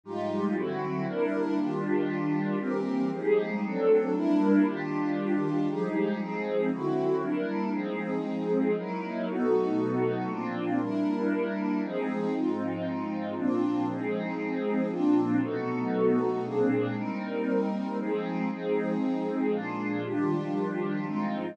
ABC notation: X:1
M:3/4
L:1/8
Q:1/4=117
K:Fdor
V:1 name="Pad 2 (warm)"
[A,,F,G,E]2 [D,^F,C=E]2 [G,B,DE]2 | [E,G,DF]4 [=E,G,B,C]2 | [F,G,A,E]2 [^F,=A,CD]2 [G,B,D=E]2 | [E,G,DF]4 [F,G,A,E]2 |
[F,A,CE]2 [D,^F,C=E]2 [G,B,DE]2 | [F,A,CE]4 [^F,^A,^D=E]2 | [=B,,^F,=A,^D]4 [_B,,=F,C=D]2 | [G,B,D=E]4 [F,A,C_E]2 |
[A,,F,CE]4 [B,,F,CD]2 | [F,A,CE]4 [B,,F,CD]2 | [=B,,^F,=A,^D]4 [_B,,_A,C=D]2 | [G,B,CE]4 [F,A,CE]2 |
[F,A,CE]4 [B,,F,A,D]2 | [E,F,G,D]4 [A,,F,CE]2 |]
V:2 name="Pad 2 (warm)"
[A,EFG]2 [D,C=E^F]2 [G,DEB]2 | [E,DFG]4 [=E,CGB]2 | [F,EGA]2 [^F,CD=A]2 [G,D=EB]2 | [E,DFG]4 [F,EGA]2 |
[F,CEA]2 [D,C=E^F]2 [G,DEB]2 | [F,CEA]4 [^F,^D=E^A]2 | [=B,^D^F=A]4 [_B,C=D=F]2 | [G,D=EB]4 [F,C_EA]2 |
[A,CEF]4 [B,CDF]2 | [F,CEA]4 [B,CDF]2 | [=B,^D^F=A]4 [_B,C=D_A]2 | [G,CEB]4 [F,CEA]2 |
[F,CEA]4 [B,DFA]2 | [E,DFG]4 [A,CEF]2 |]